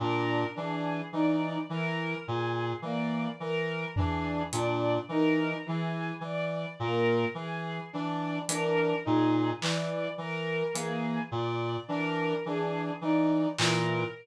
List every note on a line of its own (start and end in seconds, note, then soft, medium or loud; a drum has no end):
0.00 0.44 A#2 medium
0.00 0.45 D4 medium
0.00 0.45 A#4 medium
0.55 1.02 E3 medium
0.55 1.00 D4 medium
0.55 1.02 G#4 medium
1.12 1.58 E3 medium
1.12 1.58 D#4 medium
1.12 1.58 D5 medium
1.69 2.14 E3 medium
1.69 2.15 E3 medium
1.69 2.15 A#4 medium
2.26 2.73 A#2 medium
2.26 2.72 G#4 medium
2.82 3.27 E3 medium
2.82 3.29 A#3 medium
2.82 3.28 D5 medium
3.40 3.85 E3 medium
3.40 3.85 A#4 medium
3.96 4.43 E3 medium
3.96 4.42 D4 medium
3.96 4.42 G#4 medium
3.96 floor tom medium
4.53 4.98 A#2 medium
4.53 4.98 D4 medium
4.53 4.98 D5 medium
4.53 closed hi-hat medium
5.08 5.54 E3 medium
5.08 5.56 D#4 medium
5.08 5.55 A#4 medium
5.66 6.11 E3 medium
5.66 6.14 E3 medium
5.66 6.11 G#4 medium
6.21 6.66 E3 medium
6.21 6.68 D5 medium
6.79 7.25 A#2 medium
6.79 7.26 A#3 medium
6.79 7.25 A#4 medium
7.34 7.80 E3 medium
7.34 7.81 G#4 medium
7.92 8.39 E3 medium
7.92 8.38 D4 medium
7.92 8.38 D5 medium
8.48 8.93 E3 medium
8.48 8.95 D4 medium
8.48 8.94 A#4 medium
8.48 closed hi-hat medium
9.05 9.52 A#2 medium
9.05 9.50 D#4 medium
9.05 9.51 G#4 medium
9.61 10.06 E3 medium
9.61 10.08 E3 medium
9.61 10.08 D5 medium
9.61 clap medium
10.18 10.63 E3 medium
10.18 10.64 A#4 medium
10.74 11.19 E3 medium
10.74 11.20 A#3 medium
10.74 11.21 G#4 medium
10.74 closed hi-hat medium
11.32 11.77 A#2 medium
11.32 11.77 D5 medium
11.88 12.34 E3 medium
11.88 12.33 D4 medium
11.88 12.34 A#4 medium
12.45 12.91 E3 medium
12.45 12.92 D4 medium
12.45 12.91 G#4 medium
13.01 13.46 E3 medium
13.01 13.48 D#4 medium
13.01 13.47 D5 medium
13.58 14.04 A#2 medium
13.58 14.03 E3 medium
13.58 14.04 A#4 medium
13.58 clap loud